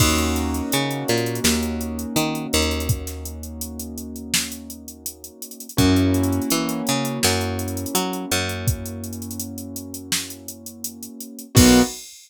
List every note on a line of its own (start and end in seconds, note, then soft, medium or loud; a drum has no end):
0.00 0.62 D#2 loud
0.00 5.66 A#3 medium
0.00 5.66 C#4 medium
0.00 5.66 D#4 medium
0.00 5.66 F#4 medium
0.00 kick medium
0.00 crash medium
0.18 closed hi-hat medium
0.36 snare soft
0.36 closed hi-hat medium
0.54 closed hi-hat medium
0.72 1.04 C#3 medium
0.72 closed hi-hat medium
0.91 closed hi-hat medium
1.08 1.40 A#2 medium
1.08 closed hi-hat medium
1.17 closed hi-hat medium
1.26 closed hi-hat medium
1.35 closed hi-hat medium
1.44 2.06 D#2 medium
1.44 snare loud
1.63 closed hi-hat medium
1.81 closed hi-hat medium
1.99 closed hi-hat medium
2.16 2.47 D#3 medium
2.16 closed hi-hat medium
2.35 closed hi-hat medium
2.53 5.30 D#2 medium
2.53 closed hi-hat medium
2.62 closed hi-hat medium
2.71 closed hi-hat medium
2.80 closed hi-hat medium
2.89 kick medium
2.89 closed hi-hat medium
3.07 snare soft
3.07 closed hi-hat medium
3.25 closed hi-hat medium
3.43 closed hi-hat medium
3.61 closed hi-hat medium
3.80 closed hi-hat medium
3.98 closed hi-hat medium
4.16 closed hi-hat soft
4.34 snare loud
4.52 closed hi-hat medium
4.70 closed hi-hat medium
4.88 closed hi-hat medium
5.06 closed hi-hat medium
5.24 closed hi-hat medium
5.42 closed hi-hat medium
5.51 closed hi-hat medium
5.60 closed hi-hat medium
5.69 closed hi-hat medium
5.77 6.40 F#2 medium
5.77 11.44 A#3 medium
5.77 11.44 C#4 medium
5.77 11.44 E4 medium
5.77 11.44 F#4 medium
5.77 kick medium
5.77 closed hi-hat medium
5.96 closed hi-hat medium
6.14 closed hi-hat medium
6.23 closed hi-hat medium
6.33 closed hi-hat medium
6.42 closed hi-hat medium
6.50 6.82 E3 medium
6.50 closed hi-hat medium
6.69 closed hi-hat medium
6.87 7.19 C#3 medium
6.87 closed hi-hat medium
7.05 closed hi-hat medium
7.23 7.86 F#2 medium
7.23 snare medium
7.41 closed hi-hat medium
7.59 closed hi-hat medium
7.68 closed hi-hat medium
7.77 closed hi-hat medium
7.86 closed hi-hat medium
7.95 8.26 F#3 medium
7.95 closed hi-hat medium
8.13 closed hi-hat medium
8.31 11.08 F#2 medium
8.31 closed hi-hat medium
8.49 closed hi-hat medium
8.67 kick medium
8.67 closed hi-hat medium
8.86 closed hi-hat medium
9.04 closed hi-hat medium
9.13 closed hi-hat medium
9.22 closed hi-hat medium
9.31 closed hi-hat medium
9.39 closed hi-hat medium
9.58 closed hi-hat medium
9.76 closed hi-hat medium
9.94 closed hi-hat medium
10.12 snare medium
10.30 closed hi-hat medium
10.48 closed hi-hat medium
10.66 closed hi-hat medium
10.84 closed hi-hat medium
11.03 closed hi-hat medium
11.20 closed hi-hat medium
11.39 closed hi-hat medium
11.55 11.82 B1 loud
11.55 11.80 A#3 loud
11.55 11.80 B3 loud
11.55 11.80 D#4 loud
11.55 11.80 F#4 loud
11.55 kick loud
11.55 crash loud